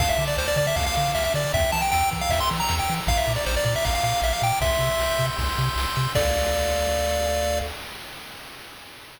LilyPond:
<<
  \new Staff \with { instrumentName = "Lead 1 (square)" } { \time 4/4 \key d \minor \tempo 4 = 156 f''16 e''8 d''16 c''16 d''16 d''16 e''16 f''16 f''16 f''8 e''16 e''16 d''8 | e''8 a''16 g''16 g''8 r16 f''16 e''16 c'''16 r16 bes''8 g''8 r16 | f''16 e''8 d''16 c''16 d''16 d''16 e''16 f''16 f''16 f''8 e''16 f''16 g''8 | e''2 r2 |
d''1 | }
  \new Staff \with { instrumentName = "Lead 1 (square)" } { \time 4/4 \key d \minor a''8 d'''8 f'''8 d'''8 a''8 d'''8 f'''8 d'''8 | g''8 bes''8 e'''8 bes''8 g''8 bes''8 e'''8 bes''8 | bes''8 d'''8 f'''8 d'''8 bes''8 d'''8 f'''8 d'''8 | c'''8 e'''8 g'''8 e'''8 c'''8 e'''8 g'''8 e'''8 |
<a' d'' f''>1 | }
  \new Staff \with { instrumentName = "Synth Bass 1" } { \clef bass \time 4/4 \key d \minor d,8 d8 d,8 d8 d,8 d8 d,8 d8 | e,8 e8 e,8 e8 e,8 e8 e,8 e8 | bes,,8 bes,8 bes,,8 bes,8 bes,,8 bes,8 bes,,8 bes,8 | c,8 c8 c,8 c8 c,8 c8 c,8 c8 |
d,1 | }
  \new DrumStaff \with { instrumentName = "Drums" } \drummode { \time 4/4 <cymc bd>8 cymr8 sn8 <bd cymr>8 <bd cymr>8 cymr8 sn8 cymr8 | <bd cymr>4 sn8 <bd cymr>8 <bd cymr>8 cymr8 sn8 cymr8 | <bd cymr>8 cymr8 sn8 <bd cymr>8 <bd cymr>8 cymr8 sn8 cymr8 | <bd cymr>8 cymr8 sn8 <bd cymr>8 <bd cymr>8 cymr8 sn8 cymr8 |
<cymc bd>4 r4 r4 r4 | }
>>